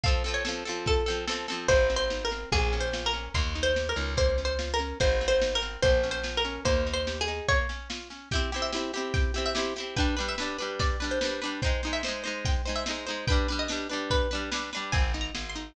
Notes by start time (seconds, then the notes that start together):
0.03 C4 A4 F5, kick, snare
0.08 F3
0.24 F3 C4 A4, snare
0.34 C#5
0.45 F3 C4 A4, snare
0.65 F3 C4 A4, snare
0.86 A4, kick, snare
1.06 F3 C4 A4, snare
1.27 F3 C4 A4, snare
1.48 F3 C4 A4, snare
1.68 G#1 G#3 C5, kick, snare
1.90 C4, snare
1.96 C5
2.10 D#4, snare
2.25 A#4
2.31 C4, snare
2.52 A#1 A#3 G#4, kick, snare
2.72 C#4, snare
2.80 C5
2.93 F4, snare
3.06 A#4
3.13 C#4, snare
3.34 D#2 A#3 C6, kick, snare
3.55 D#4, snare
3.63 C5
3.76 G4, snare
3.89 A#4
3.96 C#2 D#4, snare
4.17 A#3 C5, kick, snare
4.38 C#4, snare
4.45 C5
4.59 F4, snare
4.74 A#4
4.79 C#4, snare
5.00 G#1 G#3 C5, kick, snare
5.21 C4, snare
5.28 C5
5.41 D#4, snare
5.55 A#4
5.62 C4, snare
5.82 A#1 A#3 C5, kick, snare
6.03 C#4, snare
6.11 C5
6.24 F4, snare
6.37 A#4
6.45 C#4, snare
6.65 D#2 A#3 C5, kick, snare
6.86 D#4, snare
6.94 C5
7.07 G4, snare
7.21 G#4
7.28 D#4, snare
7.48 A#3 C#5, kick, snare
7.69 C#4, snare
7.90 F4, snare
8.10 C#4, snare
8.31 E4 G4 G5, kick, snare
8.35 C4
8.52 C4 E4 G4, snare
8.62 E5
8.72 C4 E4 G4, snare
8.93 C4 E4 G4, snare
9.14 G5, kick, snare
9.34 C4 E4 G4, snare
9.46 E5
9.55 C4 E4 G4, snare
9.76 E4 G4, snare
9.80 C4
9.96 G3 D4 B4 G5, kick, snare
10.17 G3 D4 B4, snare
10.28 E5
10.38 G3 D4 B4, snare
10.58 G3 D4 B4, snare
10.79 D5, kick, snare
11.00 G3 D4 B4, snare
11.11 C5
11.21 G3 D4 B4, snare
11.41 G3 D4 B4, snare
11.62 D#4 C5 G5, kick, snare
11.66 G#3
11.83 G#3 D#4 C5, snare
11.93 E5
12.03 D#4 C5, snare
12.08 G#3
12.24 G#3 D#4 C5, snare
12.45 G5, kick, snare
12.65 G#3 D#4 C5, snare
12.76 E5
12.86 D#4 C5, snare
12.90 G#3
13.06 G#3 D#4 C5, snare
13.27 D4 B4 G5, kick, snare
13.32 G3
13.48 G3 D4 B4, snare
13.59 D#5
13.68 G3 D4 B4, snare
13.89 G3 D4 B4, snare
14.10 B4, kick, snare
14.31 G3 D4 B4, snare
14.51 G3 D4 B4, snare
14.73 G3 D4 B4, snare
14.92 G#1 C4 G#5, kick, snare
15.14 D#4, snare
15.21 A#5
15.35 G#1 G#4, snare
15.49 C6
15.55 D#4, snare